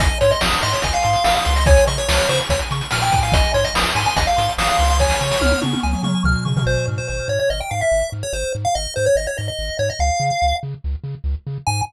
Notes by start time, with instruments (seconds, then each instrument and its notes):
0.00 synth bass 1 G#1, lead 1 (square) D#5 G#5, kick, closed hi-hat
0.21 synth bass 1 G#2, lead 1 (square) C#5 C6, closed hi-hat
0.31 lead 1 (square) D#5, closed hi-hat
0.41 synth bass 1 G#1, lead 1 (square) D#6, snare
0.53 closed hi-hat
0.62 synth bass 1 G#2, lead 1 (square) D#5 C6, closed hi-hat
0.73 lead 1 (square) C#5, closed hi-hat
0.82 synth bass 1 G#1, lead 1 (square) D#5 G#5, kick, closed hi-hat
0.93 lead 1 (square) F5, closed hi-hat
1.03 synth bass 1 G#2, lead 1 (square) C6, closed hi-hat
1.13 closed hi-hat
1.24 synth bass 1 G#1, lead 1 (square) F5 D#6, snare
1.35 lead 1 (square) F5, closed hi-hat
1.45 synth bass 1 C#2, lead 1 (square) C6, closed hi-hat
1.56 lead 1 (square) D#5, closed hi-hat
1.66 lead 1 (square) C#5 G#5, kick, closed hi-hat
1.76 closed hi-hat
1.87 synth bass 1 C#3, lead 1 (square) D#5 C#6, closed hi-hat
1.98 lead 1 (square) C#5, closed hi-hat
2.08 synth bass 1 C#2, lead 1 (square) C#5 F6, snare
2.18 closed hi-hat
2.29 synth bass 1 C#3, lead 1 (square) C5 C#6, closed hi-hat
2.39 closed hi-hat
2.49 synth bass 1 C#2, lead 1 (square) C#5 G#5, kick, closed hi-hat
2.59 closed hi-hat
2.71 synth bass 1 C#3, lead 1 (square) C#6, closed hi-hat
2.81 closed hi-hat
2.91 synth bass 1 A#2, lead 1 (square) G#5 F6, snare
3.02 lead 1 (square) G5, closed hi-hat
3.12 synth bass 1 A2, lead 1 (square) G#5, kick, closed hi-hat
3.22 lead 1 (square) F5, open hi-hat
3.32 synth bass 1 G#1, lead 1 (square) D#5, kick, closed hi-hat
3.44 closed hi-hat
3.54 synth bass 1 G#2, lead 1 (square) C#5 C6, closed hi-hat
3.64 lead 1 (square) D#5, closed hi-hat
3.74 synth bass 1 G#1, lead 1 (square) D#6, snare
3.86 closed hi-hat
3.95 synth bass 1 G#2, lead 1 (square) G#5 C6, closed hi-hat
4.05 lead 1 (square) G#5, closed hi-hat
4.16 synth bass 1 G#1, lead 1 (square) D#5 G#5, kick, closed hi-hat
4.27 lead 1 (square) F5, closed hi-hat
4.37 synth bass 1 G#2, lead 1 (square) C6, closed hi-hat
4.49 closed hi-hat
4.58 synth bass 1 G#1, lead 1 (square) F5 D#6, snare
4.68 lead 1 (square) F5, closed hi-hat
4.79 synth bass 1 C#2, lead 1 (square) C6, closed hi-hat
4.90 lead 1 (square) F5, closed hi-hat
4.99 lead 1 (square) C#5 G#5, kick, snare
5.10 snare
5.21 synth bass 1 C#3, lead 1 (square) C#6
5.31 snare
5.41 synth bass 1 C#2, lead 1 (square) F6, high tom
5.51 high tom
5.62 synth bass 1 C#3, lead 1 (square) C#6, high tom
5.73 high tom
5.83 synth bass 1 C#2, lead 1 (square) G#5, mid tom
5.93 mid tom
6.03 synth bass 1 C#3, lead 1 (square) C#6, mid tom
6.24 synth bass 1 C#2, lead 1 (square) F6, floor tom
6.45 synth bass 1 C#3, lead 1 (square) C#6, floor tom
6.57 floor tom
6.66 synth bass 1 G#1, lead 1 (square) C5
6.88 synth bass 1 G#2
6.98 lead 1 (square) C5
7.08 synth bass 1 G#1, lead 1 (square) C5
7.28 synth bass 1 G#2, lead 1 (square) C#5
7.39 lead 1 (square) C#5
7.50 synth bass 1 G#1, lead 1 (square) D#5
7.61 lead 1 (square) G5
7.71 synth bass 1 G#2, lead 1 (square) F5
7.81 lead 1 (square) E5
7.92 synth bass 1 G#1
8.12 synth bass 1 G#2
8.23 lead 1 (square) C#5
8.33 synth bass 1 G#1, lead 1 (square) C5
8.55 synth bass 1 G#2
8.65 lead 1 (square) F5
8.75 synth bass 1 G#1, lead 1 (square) D#5
8.96 synth bass 1 G#2, lead 1 (square) C5
9.06 lead 1 (square) C#5
9.15 synth bass 1 G#1, lead 1 (square) D#5
9.27 lead 1 (square) C#5
9.38 synth bass 1 G#2, lead 1 (square) D#5
9.48 lead 1 (square) D#5
9.59 synth bass 1 G#1
9.79 synth bass 1 G#2, lead 1 (square) C#5
9.90 lead 1 (square) D#5
9.99 synth bass 1 C#2, lead 1 (square) F5
10.20 synth bass 1 C#3
10.42 synth bass 1 C#2
10.63 synth bass 1 C#3
10.84 synth bass 1 C#2
11.04 synth bass 1 C#3
11.24 synth bass 1 C#2
11.47 synth bass 1 C#3
11.67 synth bass 1 G#2, lead 1 (square) G#5